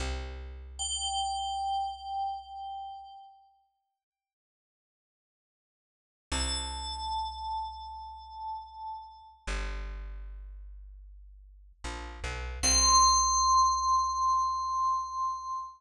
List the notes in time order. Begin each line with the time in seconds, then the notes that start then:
0.00 C2
0.79 G5
6.32 C2 A5
9.47 G1
11.84 A#1
12.24 B1
12.63 C2 C6